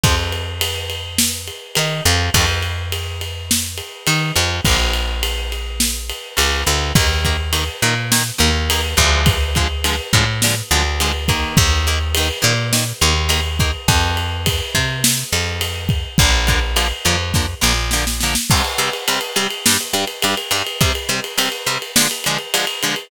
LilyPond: <<
  \new Staff \with { instrumentName = "Acoustic Guitar (steel)" } { \time 4/4 \key ees \major \tempo 4 = 104 <f c'>8 r2 r8 ees'8 f8 | <ees f a c'>8 r2 r8 ees'8 f8 | <d f bes>8 r2 r8 des8 d8 | <ees bes>8 <ees bes>8 <ees bes>8 <ees bes>8 <ees bes>8 <ees bes>8 <ees bes>8 <d f aes>8~ |
<d f aes>8 <d f aes>8 <d f aes>8 <d f aes>8 <d f aes>8 <d f aes>8 <d f aes>8 <ees bes>8~ | <ees bes>8 <ees bes>8 <ees bes>8 <ees bes>8 <ees bes>8 <ees bes>8 <ees bes>8 <ees bes>8 | r1 | <d f bes>8 <d f bes>8 <d f bes>8 <d f bes>8 <d f bes>8 <d f bes>8 <d f bes>8 <d f bes>8 |
\key c \minor <c g c'>8 <c g c'>8 <c g c'>8 <c g c'>8 <g, g d'>8 <g, g d'>8 <g, g d'>8 <g, g d'>8 | <c g c'>8 <c g c'>8 <c g c'>8 <c g c'>8 <d f aes>8 <d f aes>8 <d f aes>8 <d f aes>8 | }
  \new Staff \with { instrumentName = "Electric Bass (finger)" } { \clef bass \time 4/4 \key ees \major f,2. ees8 f,8 | f,2. ees8 f,8 | bes,,2. des,8 d,8 | ees,4. bes,4 ees,4 d,8~ |
d,4. a,4 d,4. | ees,4. bes,4 ees,4. | f,4. c4 f,4. | bes,,4. f,4 bes,,4. |
\key c \minor r1 | r1 | }
  \new DrumStaff \with { instrumentName = "Drums" } \drummode { \time 4/4 <bd cymr>8 cymr8 cymr8 cymr8 sn8 cymr8 cymr8 cymr8 | <bd cymr>8 cymr8 cymr8 cymr8 sn8 cymr8 cymr8 cymr8 | <bd cymr>8 cymr8 cymr8 cymr8 sn8 cymr8 cymr8 cymr8 | <bd cymr>8 <bd cymr>8 cymr8 cymr8 sn8 cymr8 cymr8 <bd cymr>8 |
<bd cymr>8 <bd cymr>8 cymr8 <bd cymr>8 sn8 cymr8 cymr8 <bd cymr>8 | <bd cymr>8 cymr8 cymr8 cymr8 sn8 cymr8 cymr8 <bd cymr>8 | <bd cymr>8 cymr8 <bd cymr>8 <bd cymr>8 sn8 cymr8 cymr8 <bd cymr>8 | <bd cymr>8 <bd cymr>8 cymr8 cymr8 <bd sn>8 sn8 sn16 sn16 sn16 sn16 |
<cymc bd>16 cymr16 cymr16 cymr16 cymr16 cymr16 cymr16 cymr16 sn16 cymr16 cymr16 cymr16 cymr16 cymr16 cymr16 cymr16 | <bd cymr>16 cymr16 cymr16 cymr16 cymr16 cymr16 cymr16 cymr16 sn16 cymr16 cymr16 cymr16 cymr16 cymr16 cymr16 cymr16 | }
>>